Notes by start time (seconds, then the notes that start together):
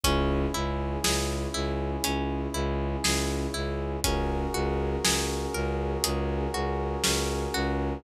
0.04 C#2 C#4 E4 G#4, kick, closed hi-hat
0.54 C#2 E4
1.04 C#2 G#4, snare
1.54 C#2 E4
2.04 C#2 C#4, closed hi-hat
2.54 C#2 E4
3.04 C#2 G#4, snare
3.54 C#2 E4
4.04 C#2 C#4 F#4 G#4 A#4, kick, closed hi-hat
4.54 C#2 F#4
5.04 C#2 G#4, snare
5.54 C#2 A#4
6.04 C#2 G#4, closed hi-hat
6.54 C#2 F#4
7.04 C#2 C#4, snare
7.54 C#2 F#4